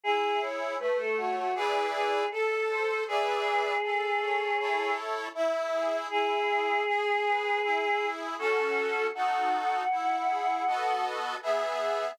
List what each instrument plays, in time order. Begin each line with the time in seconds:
0.03 accordion E4, choir aahs G#4
0.41 accordion G#4, choir aahs C#5
0.79 accordion A3, choir aahs B4
0.99 choir aahs A4
1.17 choir aahs F#4, accordion C#5
1.37 choir aahs F#4
1.55 accordion E4 G#4 B4 D5, choir aahs G#4
1.93 choir aahs G#4
2.31 choir aahs A4, accordion A4
2.69 accordion C5
3.07 accordion G#4 B4 D5 E5, choir aahs G#4
3.83 accordion A4
4.21 accordion C#5
4.59 accordion E4 A4 C#5
5.35 accordion E4, choir aahs E5
5.72 accordion G#4
6.10 accordion E4, choir aahs G#4
6.48 accordion G#4
6.87 accordion G#4
7.26 accordion B4
7.63 accordion E4
8.01 accordion G#4
8.39 accordion C#4 F#4 A4, choir aahs A4
9.15 accordion D#4 F#4 A4, choir aahs F#5
9.91 accordion E4
10.29 accordion G#4
10.67 accordion B3 F#4 A4 D#5
11.42 accordion B3 G#4 E5, choir aahs E5